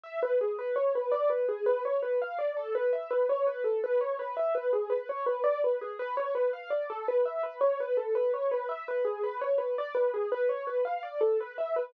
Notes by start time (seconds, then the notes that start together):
0.04 E5
0.23 B4
0.41 G#4
0.59 B4
0.76 C#5
0.95 B4
1.12 D5
1.30 B4
1.48 G#4
1.66 B4
1.85 C#5
2.02 B4
2.22 F5
2.39 D5
2.57 A4
2.75 B4
2.93 E5
3.11 B4
3.29 C#5
3.47 B4
3.64 A4
3.84 B4
4.01 C#5
4.19 B4
4.37 E5
4.55 B4
4.73 G#4
4.90 B4
5.09 C#5
5.26 B4
5.44 D5
5.64 B4
5.81 G#4
5.99 B4
6.17 C#5
6.35 B4
6.53 F5
6.70 D5
6.90 A4
7.08 B4
7.25 E5
7.43 B4
7.61 C#5
7.80 B4
7.97 A4
8.15 B4
8.34 C#5
8.51 B4
8.69 E5
8.88 B4
9.05 G#4
9.23 B4
9.41 C#5
9.58 B4
9.78 D5
9.95 B4
10.14 G#4
10.32 B4
10.49 C#5
10.67 B4
10.85 F5
11.03 D5
11.21 A4
11.40 B4
11.58 E5
11.76 B4